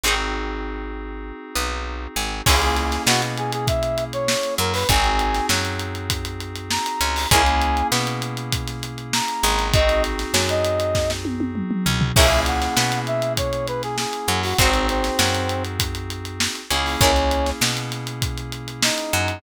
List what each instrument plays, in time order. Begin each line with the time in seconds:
0.04 electric bass (finger) G#1, electric piano 2 C4 D#4 F#4 G#4, pizzicato strings F#4 G#4 C5
0.08 pizzicato strings D#4
1.55 electric bass (finger) B1, pizzicato strings B3
2.16 electric bass (finger) G#1, pizzicato strings G#3
2.46 electric bass (finger) C#2, electric piano 2 A#3 C#4 E4 G#4, pizzicato strings E4 G#4 A#4 C#5, brass section G#4, kick, crash
2.62 brass section G#4, closed hi-hat
2.77 brass section G#4, snare, closed hi-hat
2.92 snare, closed hi-hat
3.07 electric bass (finger) B2, pizzicato strings B3, brass section F#4, snare
3.22 closed hi-hat
3.37 brass section G#4, closed hi-hat
3.53 brass section G#4, closed hi-hat
3.67 brass section E5, kick, closed hi-hat
3.83 closed hi-hat
3.98 closed hi-hat
4.13 brass section C#5, closed hi-hat
4.28 snare
4.43 closed hi-hat
4.58 electric bass (finger) F#2, pizzicato strings F#3, brass section A#4, closed hi-hat
4.74 brass section B4, open hi-hat
4.89 electric bass (finger) G#1, electric piano 2 C4 D#4 F#4 G#4, brass section G#5, kick, closed hi-hat
5.04 closed hi-hat
5.19 closed hi-hat
5.34 snare, closed hi-hat
5.49 electric bass (finger) F#2, pizzicato strings F#3, snare
5.65 closed hi-hat
5.80 closed hi-hat
5.95 closed hi-hat
6.10 kick, closed hi-hat
6.25 closed hi-hat
6.41 closed hi-hat
6.56 closed hi-hat
6.71 brass section A#5, snare
6.86 closed hi-hat
7.01 electric bass (finger) C#2, pizzicato strings C#4, closed hi-hat
7.16 open hi-hat
7.31 electric bass (finger) C#2, electric piano 2 A#3 C#4 E4 G#4, pizzicato strings G#4 A#4 C#5, brass section G#5, kick, closed hi-hat
7.35 pizzicato strings E4
7.46 closed hi-hat
7.62 closed hi-hat
7.77 closed hi-hat
7.92 electric bass (finger) B2, pizzicato strings B3, snare
8.07 closed hi-hat
8.22 closed hi-hat
8.37 closed hi-hat
8.53 kick, closed hi-hat
8.67 snare, closed hi-hat
8.83 closed hi-hat
8.98 closed hi-hat
9.13 brass section A#5, snare
9.28 closed hi-hat
9.43 electric bass (finger) G#1, pizzicato strings G#3, closed hi-hat
9.59 snare, closed hi-hat
9.74 electric piano 2 C4 D#4 F#4 G#4, brass section D#5, kick, closed hi-hat
9.89 snare, closed hi-hat
10.04 snare, closed hi-hat
10.19 snare, closed hi-hat
10.34 electric bass (finger) F#2, pizzicato strings F#3, snare
10.49 brass section D#5, closed hi-hat
10.65 closed hi-hat
10.80 closed hi-hat
10.95 kick, snare
11.10 snare
11.25 high tom
11.40 high tom
11.55 mid tom
11.71 mid tom
11.86 electric bass (finger) C#2, pizzicato strings C#4, floor tom
12.01 floor tom
12.16 electric bass (finger) C#2, electric piano 2 A#3 C#4 E4 G#4, pizzicato strings E4 G#4 A#4 C#5, brass section E5, kick, crash
12.31 closed hi-hat
12.46 brass section F#5, closed hi-hat
12.62 snare, closed hi-hat
12.77 electric bass (finger) B2, pizzicato strings B3, snare
12.92 snare, closed hi-hat
13.07 brass section E5, closed hi-hat
13.22 closed hi-hat
13.37 brass section C#5, kick, closed hi-hat
13.53 closed hi-hat
13.68 brass section B4, closed hi-hat
13.83 brass section G#4, snare, closed hi-hat
13.98 brass section G#4, snare
14.13 closed hi-hat
14.28 electric bass (finger) F#2, pizzicato strings F#3, closed hi-hat
14.43 brass section F#4, open hi-hat
14.58 electric bass (finger) G#1, brass section C4, electric piano 2 C4 D#4 F#4 G#4, pizzicato strings F#4 G#4 C5, kick, closed hi-hat
14.63 pizzicato strings D#4
14.74 closed hi-hat
14.89 brass section C4, snare, closed hi-hat
15.04 snare, closed hi-hat
15.19 electric bass (finger) F#2, pizzicato strings F#3, snare
15.34 snare, closed hi-hat
15.49 closed hi-hat
15.65 closed hi-hat
15.80 kick, closed hi-hat
15.95 closed hi-hat
16.10 closed hi-hat
16.25 closed hi-hat
16.40 snare
16.55 closed hi-hat
16.70 electric bass (finger) C#2, electric piano 2 A#3 C#4 E4 G#4, pizzicato strings C#4, closed hi-hat
16.86 open hi-hat
17.01 electric bass (finger) C#2, brass section C#4, pizzicato strings E4 G#4 A#4 C#5, kick, closed hi-hat
17.16 snare, closed hi-hat
17.31 closed hi-hat
17.46 snare, closed hi-hat
17.61 electric bass (finger) B2, pizzicato strings B3, snare
17.77 closed hi-hat
17.92 snare, closed hi-hat
18.07 closed hi-hat
18.22 kick, closed hi-hat
18.38 closed hi-hat
18.52 closed hi-hat
18.68 closed hi-hat
18.83 brass section D#4, snare
18.98 closed hi-hat
19.13 electric bass (finger) F#2, pizzicato strings F#3, closed hi-hat
19.28 closed hi-hat